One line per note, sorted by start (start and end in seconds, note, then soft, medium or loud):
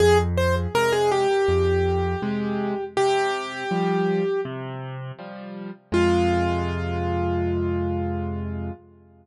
0.00 0.67 F2 loud
0.00 0.18 G#4 loud
0.38 0.55 C5 medium
0.75 1.27 C3 medium
0.75 1.27 G#3 loud
0.75 0.92 A#4 loud
0.92 1.10 G#4 loud
1.11 2.84 G4 loud
1.48 2.15 F2 loud
2.22 2.74 C3 medium
2.22 2.74 G#3 loud
2.97 3.64 C3 loud
2.97 4.41 G4 loud
3.71 4.23 F3 medium
3.71 4.23 G3 medium
4.45 5.12 C3 loud
5.19 5.70 F3 medium
5.19 5.70 G3 medium
5.92 8.70 F2 loud
5.92 8.70 C3 medium
5.92 8.70 G#3 loud
5.92 8.72 F4 loud